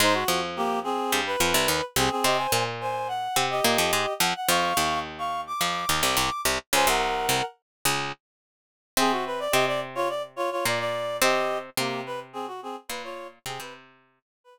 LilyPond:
<<
  \new Staff \with { instrumentName = "Clarinet" } { \time 4/4 \key aes \mixolydian \tempo 4 = 107 <ees' c''>16 fis'8 r16 <bes g'>8 <c' aes'>8. b'4~ b'16 <c' aes'>16 <c' aes'>16 | <g' ees''>16 <c'' aes''>8 r16 <c'' aes''>8 ges''8. <g' ees''>4~ <g' ees''>16 ges''16 ges''16 | <f'' des'''>4 r16 <f'' des'''>8 d'''4 d'''8. r8 | <c'' aes''>16 <bes' ges''>4~ <bes' ges''>16 r2 r8 |
<c' aes'>16 ges'16 b'16 d''16 <g' ees''>16 d''16 r16 <f' des''>16 d''16 r16 <f' des''>16 <f' des''>16 d''16 d''8. | <g' ees''>8. r16 <bes g'>8 b'16 r16 <c' aes'>16 ges'16 <c' aes'>16 r16 b'16 <f' des''>8 r16 | <c' aes'>16 b'16 r4 r16 b'4~ b'16 r4 | }
  \new Staff \with { instrumentName = "Pizzicato Strings" } { \time 4/4 \key aes \mixolydian <aes, aes>8 <f, f>4. <g, g>8 <f, f>16 <c, c>16 <ees, ees>16 r16 <c, c>16 r16 | <c c'>8 <bes, bes>4. <c c'>8 <bes, bes>16 <f, f>16 <aes, aes>16 r16 <f, f>16 r16 | <f, f>8 <ees, ees>4. <f, f>8 <ees, ees>16 <c, c>16 <c, c>16 r16 <c, c>16 r16 | <des, des>16 <c, c>8. <c, c>16 r8. <des, des>8 r4. |
<c c'>4 <c c'>2 <bes, bes>4 | <c c'>4 <c c'>2 <bes, bes>4 | <c c'>16 <c c'>4~ <c c'>16 r2 r8 | }
>>